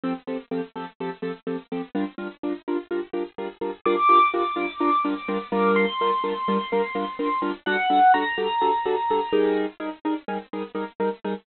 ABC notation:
X:1
M:4/4
L:1/8
Q:1/4=126
K:Gdor
V:1 name="Acoustic Grand Piano"
z8 | z8 | d'8 | c'8 |
^f2 b6 | z8 |]
V:2 name="Acoustic Grand Piano"
[F,CGA] [F,CGA] [F,CGA] [F,CGA] [F,CGA] [F,CGA] [F,CGA] [F,CGA] | [G,DFB] [G,DFB] [G,DFB] [G,DFB] [G,DFB] [G,DFB] [G,DFB] [G,DFB] | [G,DFB] [G,DFB] [G,DFB] [G,DFB] [G,DFB] [G,DFB] [G,DFB] [G,DFB]- | [G,DFB] [G,DFB] [G,DFB] [G,DFB] [G,DFB] [G,DFB] [G,DFB] [G,DFB] |
[G,D^FA] [G,DFA] [G,DFA] [G,DFA] [G,DFA] [G,DFA] [G,DFA] [G,_E_AB]- | [G,_E_AB] [G,EAB] [G,EAB] [G,EAB] [G,EAB] [G,EAB] [G,EAB] [G,EAB] |]